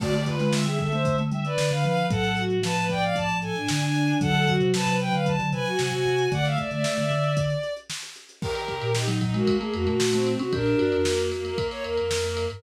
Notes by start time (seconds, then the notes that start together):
0.00 D3 A3 F#4 D5, kick, crash
0.13 A3 G4, closed hi-hat
0.25 F4 B4, kick, closed hi-hat
0.39 G#3 F4, snare, closed hi-hat
0.52 G#3 E5, snare
0.65 G3 G#4 E5, closed hi-hat
0.79 A4 E5, kick, closed hi-hat
0.92 A3 C5, closed hi-hat
1.05 kick, closed hi-hat
1.18 A3, closed hi-hat
1.32 G3 E5, closed hi-hat
1.45 B4 D5, closed hi-hat
1.58 D3, snare
1.71 D3 F5, closed hi-hat
1.84 F3 F5, snare, closed hi-hat
1.97 closed hi-hat
2.09 A2 F#3 A4 F#5, kick, closed hi-hat
2.24 closed hi-hat
2.37 F#4, closed hi-hat
2.50 closed hi-hat
2.63 F3 B4 A5, snare
2.76 B4, closed hi-hat
2.89 D5 G5, kick, closed hi-hat
3.02 F5, closed hi-hat
3.16 A5, kick, closed hi-hat
3.29 closed hi-hat
3.41 A4 G#5, closed hi-hat
3.55 D4, closed hi-hat
3.68 D3 G#5, snare
3.81 G#5, snare, closed hi-hat
3.95 closed hi-hat
4.08 closed hi-hat
4.21 D3 F#3 A4 F#5, kick, closed hi-hat
4.34 D3, closed hi-hat
4.47 F#4, kick, closed hi-hat
4.60 C3, closed hi-hat
4.73 C3 B4 A5, snare
4.87 C3 B4, closed hi-hat
5.00 B4 G5, closed hi-hat
5.13 D3 F5, closed hi-hat
5.26 A5, kick, closed hi-hat
5.39 D3, closed hi-hat
5.52 C3 B4 G#5, closed hi-hat
5.66 F#4, snare, closed hi-hat
5.79 C3 G#5, snare
5.92 C3 G#5, closed hi-hat
6.05 C3, closed hi-hat
6.18 closed hi-hat
6.31 D3 A3 D5 F#5, kick, closed hi-hat
6.45 E5 F5, snare, closed hi-hat
6.58 D5, kick, closed hi-hat
6.71 D3 D5 E5, closed hi-hat
6.84 snare
6.97 D3 E5, closed hi-hat
7.10 D3, closed hi-hat
7.24 closed hi-hat
7.37 kick, closed hi-hat
7.50 closed hi-hat
7.63 closed hi-hat
7.77 closed hi-hat
7.90 snare
8.03 closed hi-hat
8.16 closed hi-hat
8.29 closed hi-hat
8.41 D#3 G4 A#4, kick, crash
8.55 ride
8.68 C3, kick, ride
8.81 A#2, ride
8.95 D#4, snare
9.08 F#3, ride
9.21 F#3 D#4, kick, ride
9.34 G#3 A#3 F#4, ride
9.47 A#3, kick, ride
9.60 A3 G#4, ride
9.73 F2 F#4, ride
9.87 A#2 A3 F#4, ride
10.00 snare
10.13 A3 C4, snare, ride
10.27 ride
10.39 C3 C#4 F#4, ride
10.52 A#2 D4 G4 A#4, kick, ride
10.66 ride
10.79 G2 F#4, ride
10.92 F2, ride
11.05 A#3, snare
11.18 ride
11.31 A#3, snare, ride
11.44 A#3 A#4, ride
11.57 A#3, kick, ride
11.71 C#5, snare, ride
11.84 D#2 A#4, ride
11.97 F2 A#4, ride
12.11 snare
12.23 A#3, ride
12.37 ride
12.50 G2 A#4, ride